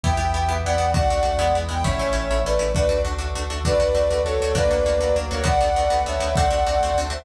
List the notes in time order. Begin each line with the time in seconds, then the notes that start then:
0.03 E2 B3 E4 G4 E5 G5, kick
0.17 E2 B3 E4 G4
0.34 E2 B3 E4 G4
0.49 E2 B3 E4 G4 B4
0.64 E2 B3 E4 G4 D5 F#5
0.78 E2 B3 E4 G4
0.94 D2 A3 D4 F#4 D5 F#5, kick
1.10 D2 A3 D4 F#4
1.23 D2 A3 D4 F#4
1.38 E2 G#3 B3 E4
1.55 E2 G#3 B3 E4
1.69 E2 G#3 B3 E4 G5
1.84 A1 A3 C#4 E4 C#5 E5, kick
1.99 A1 A3 C#4 E4
2.13 A1 A3 C#4 E4
2.29 A1 A3 C#4 E4 A4
2.44 A1 A3 C#4 E4 B4 D5
2.59 A1 A3 C#4 E4
2.74 D2 A3 D4 F#4 B4 D5, kick
2.89 D2 A3 D4 F#4
3.05 D2 A3 D4 F#4
3.18 D2 A3 D4 F#4 A4
3.34 D2 A3 D4 F#4
3.50 D2 A3 D4 F#4
3.64 D2 A3 D4 F#4 B4 D5, kick
3.80 D2 A3 D4 F#4
3.95 D2 A3 D4 F#4
4.10 D2 A3 D4 F#4 A4
4.24 D2 A3 D4 F#4 A4 C#5
4.40 D2 A3 D4 F#4
4.55 D2 A#3 D4 F#4 B4 D5, kick
4.70 D2 A#3 D4 F#4
4.86 D2 A#3 D4 F#4
5.00 D2 F#3 A#3 D4 F#4
5.16 D2 A#3 D4 F#4
5.31 D2 A#3 D4 F#4 A#4 C#5
5.44 D2 A3 B3 D4 F#4 A4 B4 D5 F#5, kick
5.61 D2 A3 B3 D4 F#4
5.75 D2 A3 B3 D4 F#4
5.90 D2 A3 B3 D4 F#4 A4 B4 F#5 A5
6.05 D2 A3 B3 D4 F#4 C#5 E5
6.19 D2 A3 B3 D4 F#4
6.35 D2 A3 C4 D4 F#4 A4 C5 D5 F#5, kick
6.51 D2 A3 C4 D4 F#4
6.66 D2 A3 C4 D4 F#4
6.80 D2 A3 C4 D4 F#4 A4 C5 F#5 A5
6.94 D2 A3 C4 D4 F#4
7.10 D2 A3 C4 D4 F#4 C5 E5